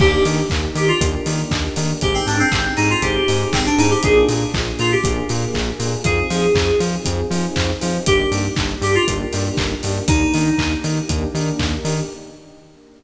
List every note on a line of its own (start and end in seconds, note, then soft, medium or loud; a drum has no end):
0.00 0.14 D#2 medium
0.00 0.40 A#3 medium
0.00 1.00 A#3 medium
0.00 0.40 D4 medium
0.00 1.00 D4 medium
0.00 0.40 D#4 medium
0.00 1.00 D#4 medium
0.00 0.40 G4 medium
0.00 0.23 G4 loud
0.00 1.00 G4 medium
0.00 kick loud
0.00 crash medium
0.25 0.39 D#3 medium
0.25 open hi-hat medium
0.50 0.65 D#2 medium
0.50 kick medium
0.50 clap medium
0.75 0.89 D#3 medium
0.75 0.88 G4 loud
0.75 open hi-hat medium
0.88 1.00 F4 medium
1.01 1.14 D#2 medium
1.01 2.00 A#3 medium
1.01 1.21 A#3 medium
1.01 2.00 D4 medium
1.01 1.21 D4 medium
1.01 1.21 D#4 medium
1.01 2.00 G4 medium
1.01 1.21 G4 medium
1.01 2.00 A#4 medium
1.01 kick medium
1.01 closed hi-hat loud
1.26 1.40 D#3 medium
1.26 1.67 A#3 medium
1.26 1.67 D4 medium
1.26 1.67 D#4 medium
1.26 1.67 G4 medium
1.26 open hi-hat medium
1.51 1.65 D#2 medium
1.51 kick medium
1.51 clap medium
1.76 1.91 D#3 medium
1.76 1.97 A#3 medium
1.76 1.97 D4 medium
1.76 1.97 D#4 medium
1.76 1.97 G4 medium
1.76 open hi-hat medium
2.01 2.16 G#1 loud
2.01 3.01 C4 medium
2.01 2.42 C4 medium
2.01 3.01 D#4 medium
2.01 2.42 D#4 medium
2.01 3.01 G4 medium
2.01 2.42 G4 medium
2.01 2.14 G4 loud
2.01 3.01 G#4 medium
2.01 2.42 G#4 medium
2.01 kick medium
2.01 closed hi-hat medium
2.14 2.26 C4 medium
2.27 2.40 G#2 medium
2.27 2.39 D4 medium
2.27 open hi-hat medium
2.39 2.72 C4 loud
2.52 2.66 G#1 medium
2.52 kick medium
2.52 clap loud
2.77 2.92 G#2 medium
2.77 2.89 D#4 loud
2.77 open hi-hat medium
2.90 3.02 F4 loud
3.02 3.16 G#1 medium
3.02 4.02 C4 medium
3.02 3.22 C4 medium
3.02 4.02 D#4 medium
3.02 3.22 D#4 medium
3.02 3.22 G4 medium
3.02 3.47 G4 medium
3.02 4.02 G#4 medium
3.02 3.22 G#4 medium
3.02 4.02 C5 medium
3.02 kick medium
3.02 closed hi-hat medium
3.28 3.42 G#2 medium
3.28 3.68 C4 medium
3.28 3.68 D#4 medium
3.28 3.68 G4 medium
3.28 3.68 G#4 medium
3.28 open hi-hat medium
3.53 3.66 G#1 medium
3.53 3.65 C4 medium
3.53 kick medium
3.53 clap loud
3.66 3.78 D4 loud
3.78 3.92 G#2 medium
3.78 3.98 C4 medium
3.78 3.98 D#4 medium
3.78 3.90 D#4 loud
3.78 3.98 G4 medium
3.78 3.98 G#4 medium
3.78 open hi-hat medium
3.90 4.02 G4 medium
4.03 4.17 A#1 loud
4.03 5.03 A#3 medium
4.03 4.44 A#3 medium
4.03 5.03 D4 medium
4.03 4.44 D4 medium
4.03 5.03 F4 medium
4.03 4.44 F4 medium
4.03 5.03 G#4 medium
4.03 4.44 G#4 medium
4.03 4.25 G#4 loud
4.03 kick medium
4.03 closed hi-hat medium
4.29 4.43 A#2 medium
4.29 open hi-hat medium
4.54 4.68 A#1 medium
4.54 kick medium
4.54 clap medium
4.79 4.93 A#2 medium
4.79 4.91 F4 medium
4.79 open hi-hat medium
4.92 5.04 G4 loud
5.04 5.18 A#1 medium
5.04 6.04 A#3 medium
5.04 5.25 A#3 medium
5.04 6.04 D4 medium
5.04 5.25 D4 medium
5.04 5.25 F4 medium
5.04 6.04 G#4 medium
5.04 5.25 G#4 medium
5.04 6.04 A#4 medium
5.04 kick medium
5.04 closed hi-hat medium
5.29 5.44 A#2 medium
5.29 5.70 A#3 medium
5.29 5.70 D4 medium
5.29 5.70 F4 medium
5.29 5.70 G#4 medium
5.29 open hi-hat medium
5.54 5.69 A#1 medium
5.54 kick medium
5.54 clap medium
5.80 5.93 A#2 medium
5.80 6.00 A#3 medium
5.80 6.00 D4 medium
5.80 6.00 F4 medium
5.80 6.00 G#4 medium
5.80 open hi-hat medium
6.04 6.18 F2 medium
6.04 6.45 C4 medium
6.04 7.05 C4 medium
6.04 6.45 D#4 medium
6.04 7.05 D#4 medium
6.04 6.45 F4 medium
6.04 7.05 F4 medium
6.04 6.45 G#4 medium
6.04 6.78 G#4 loud
6.04 7.05 G#4 medium
6.04 kick medium
6.04 closed hi-hat medium
6.30 6.44 F3 medium
6.30 open hi-hat medium
6.55 6.69 F2 medium
6.55 kick medium
6.55 clap loud
6.80 6.94 F3 medium
6.80 open hi-hat medium
7.05 7.20 F2 medium
7.05 8.05 C4 medium
7.05 7.26 C4 medium
7.05 8.05 D#4 medium
7.05 7.26 D#4 medium
7.05 7.26 F4 medium
7.05 8.05 G#4 medium
7.05 7.26 G#4 medium
7.05 8.05 C5 medium
7.05 kick medium
7.05 closed hi-hat loud
7.31 7.44 F3 medium
7.31 7.71 C4 medium
7.31 7.71 D#4 medium
7.31 7.71 F4 medium
7.31 7.71 G#4 medium
7.31 open hi-hat medium
7.56 7.70 F2 medium
7.56 kick medium
7.56 clap loud
7.81 7.97 F3 medium
7.81 8.01 C4 medium
7.81 8.01 D#4 medium
7.81 8.01 F4 medium
7.81 8.01 G#4 medium
7.81 open hi-hat medium
8.06 8.21 G1 loud
8.06 8.47 A#3 medium
8.06 9.07 A#3 medium
8.06 8.47 D4 medium
8.06 9.07 D4 medium
8.06 8.47 D#4 medium
8.06 9.07 D#4 medium
8.06 8.27 G4 loud
8.06 8.47 G4 medium
8.06 9.07 G4 medium
8.06 kick medium
8.06 closed hi-hat loud
8.32 8.46 G2 medium
8.32 open hi-hat medium
8.56 8.72 G1 medium
8.56 kick medium
8.56 clap loud
8.82 8.95 G2 medium
8.82 8.95 G4 loud
8.82 open hi-hat medium
8.95 9.07 F4 loud
9.07 9.22 G1 medium
9.07 9.28 A#3 medium
9.07 10.07 A#3 medium
9.07 9.28 D4 medium
9.07 10.07 D4 medium
9.07 9.28 D#4 medium
9.07 9.28 G4 medium
9.07 10.07 G4 medium
9.07 10.07 A#4 medium
9.07 kick medium
9.07 closed hi-hat medium
9.33 9.48 G2 medium
9.33 9.73 A#3 medium
9.33 9.73 D4 medium
9.33 9.73 D#4 medium
9.33 9.73 G4 medium
9.33 open hi-hat medium
9.57 9.72 G1 medium
9.57 kick medium
9.57 clap loud
9.83 9.98 G2 medium
9.83 10.04 A#3 medium
9.83 10.04 D4 medium
9.83 10.04 D#4 medium
9.83 10.04 G4 medium
9.83 open hi-hat medium
10.08 10.22 D#2 medium
10.08 10.49 A#3 medium
10.08 11.09 A#3 medium
10.08 10.49 D4 medium
10.08 11.09 D4 medium
10.08 10.70 D#4 loud
10.08 10.49 D#4 medium
10.08 11.09 D#4 medium
10.08 10.49 G4 medium
10.08 11.09 G4 medium
10.08 kick loud
10.08 closed hi-hat loud
10.34 10.48 D#3 medium
10.34 open hi-hat medium
10.58 10.72 D#2 medium
10.58 kick medium
10.58 clap medium
10.84 10.98 D#3 medium
10.84 open hi-hat medium
11.09 11.23 D#2 medium
11.09 11.29 A#3 medium
11.09 12.09 A#3 medium
11.09 11.29 D4 medium
11.09 12.09 D4 medium
11.09 11.29 D#4 medium
11.09 11.29 G4 medium
11.09 12.09 G4 medium
11.09 12.09 A#4 medium
11.09 kick medium
11.09 closed hi-hat medium
11.34 11.48 D#3 medium
11.34 11.75 A#3 medium
11.34 11.75 D4 medium
11.34 11.75 D#4 medium
11.34 11.75 G4 medium
11.34 open hi-hat medium
11.59 11.73 D#2 medium
11.59 kick medium
11.59 clap medium
11.85 11.98 D#3 medium
11.85 12.05 A#3 medium
11.85 12.05 D4 medium
11.85 12.05 D#4 medium
11.85 12.05 G4 medium
11.85 open hi-hat medium